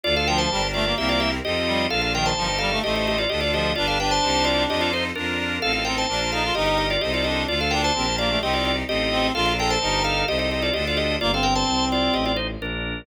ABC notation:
X:1
M:4/4
L:1/16
Q:1/4=129
K:Bb
V:1 name="Drawbar Organ"
[Fd] [Af] [Bg] [ca]3 [Fd]2 [G=e] [Fd] [Ge] z [G_e]4 | [Af] [Af] [Bg] [ca]3 [Af]2 [Ge] [Ge] [Ge] [Fd] [Ge] [Fd] [Ge]2 | [Fd] [Af] [=Bg] [ca]3 [Fd]2 [Ge] [Fd] [Ec] z [D_B]4 | [Af] [Af] [Bg] [ca]3 [Af]2 [Ge] [Ge] [Ge] [Fd] [Ge] [Fd] [Ge]2 |
[Fd] [Af] [Bg] [ca]3 [Fd]2 [Ge] [Fd] [Fd] z [Ge]4 | [Af] [Af] [Bg] [ca]3 [Af]2 [Ge] [Ge] [Ge] [Fd] [Ge] [Fd] [Ge]2 | [Fd] [Af] [Bg] [ca]3 [Fd]2 [Ge] [Fd] [Ec] z [DB]4 |]
V:2 name="Clarinet"
z2 F,2 G, z A, B, B,3 z3 G,2 | z2 E,2 F, z G, A, A,3 z3 F,2 | D2 D8 z6 | z2 C2 D z E F E3 z3 D2 |
z2 D2 C z B, A, C3 z3 C2 | F2 A2 E4 z8 | B, C9 z6 |]
V:3 name="Accordion"
[DFA]4 [DGB]4 [C=EGB]4 [C_EFA]4 | [DFB]4 [EGB]4 [EAc]4 [DFA]4 | [DG=B]4 [EGc]4 [EFAc]4 [DF_B]4 | [CEFA]4 [DFB]4 [EGB]4 [EAc]4 |
[DFA]4 [DGB]4 [CEG]4 [CEFA]4 | [DFB]4 [EGB]4 [EAc]4 [DFA]4 | z16 |]
V:4 name="Violin" clef=bass
D,,4 G,,,4 C,,4 F,,4 | B,,,4 G,,,4 A,,,4 D,,4 | G,,,4 C,,4 F,,4 F,,4 | A,,,4 B,,,4 G,,,4 C,,4 |
D,,4 B,,,4 C,,4 A,,,4 | B,,,4 G,,,4 C,,4 D,,4 | G,,,4 C,,4 A,,,4 B,,,4 |]